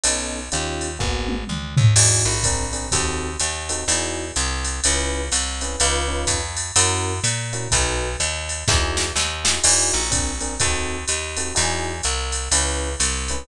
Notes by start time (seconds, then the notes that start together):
0.04 B1 B3 C#4 D#4 A4, ride
0.52 D#2 C#4 D#4 F4 G4, hi-hat pedal, ride
0.81 ride
0.99 G#1 A#3 B3 F#4 G#4, kick
1.28 high tom
1.48 D2, mid tom
1.77 D#2, floor tom
1.96 E2 D#4 E4 F#4 G#4, crash, ride
2.25 A#1
2.43 C4 D4 G#4 A#4, kick, hi-hat pedal, ride
2.73 C4 D4 G#4 A#4, ride
2.92 D#2 C4 D#4 F#4 A4, kick, ride
3.40 D#2, hi-hat pedal, ride
3.69 C4 D#4 F#4 A4, ride
3.88 E2 D#4 E4 F#4 G#4, ride
4.36 C2, hi-hat pedal, ride
4.64 ride
4.84 C#2 C#4 E4 G#4 B4, ride
5.32 C2, hi-hat pedal, ride
5.61 C#4 E4 G#4 B4, ride
5.80 C#2 C#4 D#4 F4 B4, ride
6.08 C#4 D#4 F4 B4
6.27 F2, kick, hi-hat pedal, ride
6.57 ride
6.76 F#2 C#4 E4 F#4 A#4, ride
7.24 A#2, hi-hat pedal, ride
7.53 C#4 E4 F#4 A#4, ride
7.71 B1 D#4 F#4 A4 B4, kick, ride
8.20 D#2, hi-hat pedal, ride
8.49 ride
8.68 E2 D#4 E4 F#4 G#4, kick, snare
8.97 snare
9.15 D#2, snare
9.44 D#4 E4 F#4 G#4, snare
9.64 E2 D#4 E4 F#4 G#4, crash, ride
9.93 A#1
10.11 C4 D4 G#4 A#4, kick, hi-hat pedal, ride
10.40 C4 D4 G#4 A#4, ride
10.60 D#2 C4 D#4 F#4 A4, kick, ride
11.08 D#2, hi-hat pedal, ride
11.37 C4 D#4 F#4 A4, ride
11.55 E2 D#4 E4 F#4 G#4, ride
12.03 C2, hi-hat pedal, ride
12.32 ride
12.51 C#2 C#4 E4 G#4 B4, ride
13.00 C2, hi-hat pedal, ride
13.28 C#4 E4 G#4 B4, ride